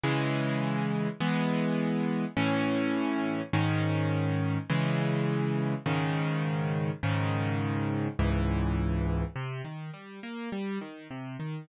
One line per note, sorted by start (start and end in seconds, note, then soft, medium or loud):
0.04 1.08 C#3 medium
0.04 1.08 E3 loud
0.04 1.08 G#3 loud
1.20 2.25 E3 medium
1.20 2.25 G#3 medium
1.20 2.25 B3 loud
2.37 3.42 A2 loud
2.37 3.42 E3 loud
2.37 3.42 C#4 loud
3.53 4.58 G#2 loud
3.53 4.58 D#3 loud
3.53 4.58 C#4 loud
4.70 5.74 C#3 loud
4.70 5.74 E3 loud
4.70 5.74 G#3 medium
5.86 6.91 G#2 loud
5.86 6.91 C#3 loud
5.86 6.91 D#3 loud
7.03 8.08 G#2 loud
7.03 8.08 C#3 medium
7.03 8.08 D#3 loud
8.19 9.24 C#2 loud
8.19 9.24 G#2 medium
8.19 9.24 E3 loud
9.36 9.62 C3 medium
9.64 9.91 D#3 medium
9.94 10.20 G3 medium
10.23 10.49 A#3 medium
10.52 10.79 G3 medium
10.81 11.08 D#3 medium
11.11 11.37 C3 medium
11.40 11.66 D#3 medium